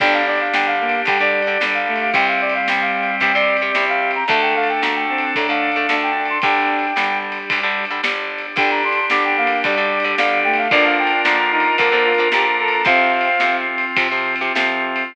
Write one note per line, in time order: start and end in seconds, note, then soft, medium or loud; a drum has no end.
0.00 0.48 G1 medium
0.00 0.43 D3 medium
0.00 0.43 G3 loud
0.00 0.22 D4 medium
0.00 2.10 D4 medium
0.00 2.11 D4 medium
0.00 2.10 G4 medium
0.00 2.11 G4 medium
0.00 0.13 G5 medium
0.00 kick loud
0.00 crash loud
0.14 0.26 F5 medium
0.27 0.73 D4 medium
0.27 0.40 D5 medium
0.36 ride medium
0.40 0.53 F5 medium
0.54 1.02 G1 medium
0.54 0.97 D3 medium
0.54 0.97 G3 medium
0.54 0.66 G5 medium
0.54 snare loud
0.67 1.01 F5 medium
0.80 1.01 A#3 medium
0.89 ride medium
1.05 1.53 D2 medium
1.05 1.18 D3 medium
1.05 1.56 G3 medium
1.05 1.18 G3 medium
1.05 1.20 G5 medium
1.05 kick loud
1.05 ride loud
1.20 1.42 D3 medium
1.20 1.42 G3 medium
1.20 1.64 D5 medium
1.43 ride medium
1.47 1.58 D3 medium
1.47 1.58 G3 medium
1.60 2.09 G1 medium
1.60 2.04 D3 medium
1.60 1.86 G3 medium
1.60 2.04 G3 medium
1.60 snare loud
1.74 2.00 F5 medium
1.87 2.12 A3 medium
1.96 ride medium
2.01 2.14 F5 medium
2.13 2.62 C2 medium
2.13 2.57 C3 medium
2.13 3.71 G3 medium
2.13 2.57 G3 medium
2.13 4.25 C4 medium
2.13 4.24 C4 medium
2.13 4.25 G4 medium
2.13 4.24 G4 medium
2.13 2.27 G5 medium
2.13 kick loud
2.13 ride loud
2.28 2.41 F5 medium
2.41 2.54 D5 medium
2.50 ride medium
2.55 2.67 F5 medium
2.68 3.18 C2 medium
2.68 3.11 C3 medium
2.68 3.11 G3 medium
2.68 2.81 G5 medium
2.68 snare loud
2.81 3.15 F5 medium
3.03 ride medium
3.20 3.69 G2 medium
3.20 3.32 C3 medium
3.20 3.32 G3 medium
3.20 3.34 G5 medium
3.20 kick loud
3.20 ride loud
3.35 3.56 C3 medium
3.35 3.56 G3 medium
3.35 3.85 D5 medium
3.57 ride medium
3.61 3.72 C3 medium
3.61 3.72 G3 medium
3.75 4.24 C2 medium
3.75 4.18 C3 medium
3.75 4.18 G3 medium
3.75 snare loud
3.89 4.11 F5 medium
4.11 ride medium
4.15 4.28 A#5 medium
4.28 4.76 D2 medium
4.28 4.72 D3 medium
4.28 4.54 A3 medium
4.28 4.72 A3 loud
4.28 6.38 D4 medium
4.28 6.41 D4 medium
4.28 6.38 A4 medium
4.28 6.41 A4 medium
4.28 4.41 A5 medium
4.28 kick loud
4.28 ride loud
4.42 4.55 G5 medium
4.55 5.04 A3 medium
4.55 4.68 F5 medium
4.64 ride medium
4.69 4.82 G5 medium
4.82 5.31 D2 medium
4.82 5.25 D3 medium
4.82 5.25 A3 medium
4.82 4.95 A#5 medium
4.82 snare loud
4.95 5.31 G5 medium
5.09 5.33 C4 medium
5.18 ride medium
5.35 5.85 A2 medium
5.35 5.46 D3 medium
5.35 5.46 A3 medium
5.35 5.85 D4 medium
5.35 5.49 A#5 medium
5.35 kick loud
5.35 ride loud
5.49 5.70 D3 medium
5.49 5.70 A3 medium
5.49 5.95 F5 medium
5.72 ride medium
5.76 5.87 D3 medium
5.76 5.87 A3 medium
5.89 6.38 D2 medium
5.89 6.32 D3 medium
5.89 6.32 A3 medium
5.89 6.11 D4 medium
5.89 snare loud
6.03 6.27 G5 medium
6.17 6.39 D4 medium
6.26 ride medium
6.30 6.42 C6 medium
6.42 6.91 G1 medium
6.42 6.86 D3 medium
6.42 6.86 G3 medium
6.42 8.55 D4 medium
6.42 6.93 D4 medium
6.42 8.55 G4 medium
6.42 7.18 G5 medium
6.42 kick loud
6.42 ride loud
6.79 ride medium
6.96 7.45 G1 medium
6.96 7.39 D3 medium
6.96 7.39 G3 medium
6.96 7.85 G3 medium
6.96 snare loud
7.32 ride medium
7.50 8.00 D2 medium
7.50 7.60 D3 medium
7.50 7.60 G3 medium
7.50 kick loud
7.50 ride loud
7.63 7.85 D3 medium
7.63 7.85 G3 medium
7.85 ride medium
7.91 8.01 D3 medium
7.91 8.01 G3 medium
8.03 8.52 G1 medium
8.03 8.46 D3 medium
8.03 8.46 G3 medium
8.03 snare loud
8.39 ride medium
8.56 9.04 G1 medium
8.56 9.00 D3 medium
8.56 9.00 G3 medium
8.56 10.68 D4 medium
8.56 10.67 D4 medium
8.56 8.81 D4 medium
8.56 10.68 G4 medium
8.56 10.67 G4 medium
8.56 8.70 G5 medium
8.56 kick loud
8.56 ride loud
8.71 8.83 A#5 medium
8.84 9.36 D4 medium
8.84 9.06 C6 medium
8.93 ride medium
9.10 9.59 G1 medium
9.10 9.54 D3 medium
9.10 9.54 G3 medium
9.10 9.23 D6 medium
9.10 snare loud
9.24 9.37 G5 medium
9.37 9.63 A#3 medium
9.37 9.59 F5 medium
9.47 ride loud
9.64 10.13 D2 medium
9.64 9.75 D3 medium
9.64 10.16 G3 medium
9.64 9.75 G3 medium
9.64 10.12 D5 medium
9.64 kick loud
9.64 ride loud
9.77 9.99 D3 medium
9.77 9.99 G3 medium
10.00 ride medium
10.04 10.15 D3 medium
10.04 10.15 G3 medium
10.18 10.66 G1 medium
10.18 10.61 D3 medium
10.18 10.42 G3 medium
10.18 10.61 G3 medium
10.18 10.39 F5 medium
10.18 snare loud
10.44 10.68 A3 medium
10.44 10.57 G5 medium
10.54 ride medium
10.58 10.71 F5 medium
10.71 11.21 A#1 medium
10.71 11.14 D3 medium
10.71 11.14 F3 medium
10.71 11.14 A#3 medium
10.71 11.77 D4 medium
10.71 11.37 D4 medium
10.71 12.82 D4 medium
10.71 11.77 F4 medium
10.71 12.82 F4 medium
10.71 11.77 A#4 medium
10.71 12.82 A#4 medium
10.71 10.84 D5 medium
10.71 kick loud
10.71 ride loud
10.85 10.98 F5 medium
10.99 11.21 G5 medium
11.07 ride medium
11.25 11.73 A#1 medium
11.25 11.68 D3 medium
11.25 11.68 F3 medium
11.25 11.68 A#3 medium
11.25 11.38 A#5 medium
11.25 snare loud
11.39 11.51 A#5 medium
11.51 11.76 D#4 medium
11.51 11.75 A#5 medium
11.60 ride medium
11.78 12.27 F2 medium
11.78 11.89 D3 medium
11.78 11.89 F3 medium
11.78 12.84 A#3 medium
11.78 11.89 A#3 medium
11.78 12.84 D4 medium
11.78 12.84 A#4 medium
11.78 12.28 A#4 medium
11.78 kick loud
11.78 ride loud
11.92 12.13 D3 medium
11.92 12.13 F3 medium
11.92 12.13 A#3 medium
12.05 12.28 F4 medium
12.14 12.29 D3 medium
12.14 ride medium
12.19 12.29 F3 medium
12.19 12.29 A#3 medium
12.32 12.81 A#1 medium
12.32 12.76 D3 medium
12.32 12.76 F3 medium
12.32 12.76 A#3 medium
12.32 12.45 G4 medium
12.32 12.56 A#5 medium
12.32 snare loud
12.59 12.84 A4 medium
12.59 12.72 A#5 medium
12.68 ride medium
12.72 12.85 A#5 medium
12.84 13.34 F2 medium
12.84 13.29 C3 medium
12.84 13.29 F3 medium
12.84 15.13 C4 medium
12.84 13.65 C4 medium
12.84 15.12 C4 medium
12.84 15.13 F4 medium
12.84 15.12 F4 medium
12.84 13.56 F5 medium
12.84 kick loud
12.84 ride loud
13.21 ride medium
13.40 13.92 F2 medium
13.40 13.85 C3 medium
13.40 13.85 F3 medium
13.40 snare loud
13.78 ride medium
13.96 14.08 C3 medium
13.96 14.50 C3 medium
13.96 14.08 F3 medium
13.96 kick loud
13.96 ride loud
14.11 14.35 C3 medium
14.11 14.35 F3 medium
14.36 ride medium
14.41 14.53 C3 medium
14.41 14.53 F3 medium
14.55 15.10 F2 medium
14.55 15.04 C3 medium
14.55 15.04 F3 medium
14.55 snare loud
14.96 ride medium